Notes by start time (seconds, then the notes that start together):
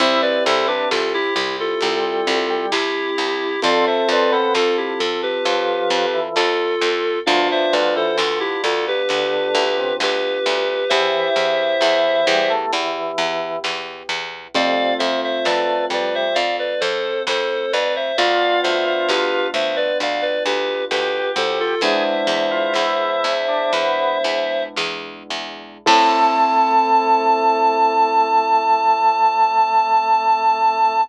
0.00 C2 C4 E4 G4 C5 E5, kick, closed hi-hat
0.22 B4 D5
0.45 C2 E4 A4 C5
0.67 D4 G4 B4
0.91 C2 F4 A4, snare
1.14 E4 G4
1.35 C2 E4 G4
1.60 F4 A4
1.81 C2 G3, closed hi-hat
2.27 C2
2.50 G3
2.71 C2 E4 G4, snare
3.18 C2
3.62 F2 C4 F4 A4 D5 F5, kick, closed hi-hat
3.87 C5 E5
4.09 F2 C4 B4 D5
4.32 B3 A4 C5
4.55 F2 F4 A4, snare
4.77 E4 G4
4.99 F2 F4 A4
5.23 G4 B4
5.45 F2 F3, closed hi-hat
5.90 F2
6.14 E3
6.36 F2 F4 A4, snare
6.81 F2
7.26 D2 F3 B3 D4 F4 D5 F5, kick, closed hi-hat
7.51 C5 E5
7.73 D2 F3 B4 D5
7.95 E3 A4 C5
8.17 D2 F4 A4, snare
8.40 E4 G4
8.64 D2 F4 A4
8.88 G4 B4
9.09 D2 D3, closed hi-hat
9.55 D2
9.77 C3
10.00 D2 G4 B4, snare
10.46 D2
10.89 E2 E3 B3 E4 G4 C5 E5, kick, closed hi-hat
11.36 E2
11.81 E2 E3, snare
12.27 E2 G3
12.50 A3
12.73 E2 E3, closed hi-hat
13.18 E2
13.64 E2, snare
14.09 E2
14.54 F2 C3 A3 C4 F4 D5 F5, kick, closed hi-hat
14.99 F2 C5 E5
15.24 C5 E5
15.45 F2 A3 B4 D5, snare
15.90 F2 G3 B4 D5
16.15 C5 E5
16.34 F2 D5 F5, closed hi-hat
16.59 B4 D5
16.80 F2 A4 C5
17.27 F2 A4 C5, snare
17.73 F2 B4 D5
17.96 C5 E5
18.18 D2 B3 D4 F4 D5 F5, kick, closed hi-hat
18.63 D2 C5 E5
18.86 C5 E5
19.08 D2 G4 B4, snare
19.54 D2 C5 E5
19.76 B4 D5
20.00 D2 D5 F5, closed hi-hat
20.22 B4 D5
20.45 D2 G4 B4
20.91 D2 G4 B4, snare
21.36 D2 A4 C5
21.60 F4 A4
21.81 E2 G#3 B3 D4 E4 G#4 C5 E5, kick, closed hi-hat
22.27 E2
22.51 F4
22.74 E2 E4, snare
23.24 E2
23.48 D4
23.73 E2 B3, closed hi-hat
24.24 E2
24.77 E2, snare
25.30 E2
25.86 A2 A3 C4 E4 A4 A5, kick, crash